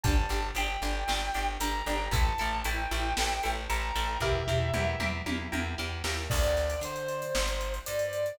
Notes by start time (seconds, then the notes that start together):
0.03 G1 D4 G4 A5, kick, closed hi-hat
0.29 G1 D4 G4, closed hi-hat
0.55 G1 D4 G4 G5, closed hi-hat
0.82 G1 D4 G4, closed hi-hat
1.08 G1 D4 G4, snare
1.34 G1 D4 G4, closed hi-hat
1.60 G1 D4 G4 A#5, closed hi-hat
1.86 G1 D4 G4, closed hi-hat
2.11 A1 E4 A4 A5, kick, closed hi-hat
2.38 A1 E4 A4, closed hi-hat
2.64 A1 E4 A4 G5, closed hi-hat
2.91 A1 E4 A4, closed hi-hat
3.17 A1 E4 A4, snare
3.43 A1 E4 A4, closed hi-hat
3.70 A1 E4 A4 A#5, closed hi-hat
3.96 A1 E4 A4, closed hi-hat
4.20 E2 E4 G4 A#4 E5, kick, floor tom
4.47 E2 E4 G4 A#4, floor tom
4.74 E2 E4 G4 A#4, mid tom
5.00 E2 E4 G4 A#4, mid tom
5.26 E2 E4 G4 A#4, high tom
5.52 E2 E4 G4 A#4, high tom
5.78 E2 E4 G4 A#4
6.04 D#2 E4 G4 A#4, snare
6.30 D2 D5, kick, crash
6.43 closed hi-hat
6.57 snare, closed hi-hat
6.70 closed hi-hat
6.81 D3 C5, closed hi-hat
6.96 closed hi-hat
7.08 closed hi-hat
7.22 closed hi-hat
7.35 G1, snare
7.48 closed hi-hat
7.61 closed hi-hat
7.74 closed hi-hat
7.86 G2 D5, closed hi-hat
7.99 closed hi-hat
8.13 closed hi-hat
8.26 closed hi-hat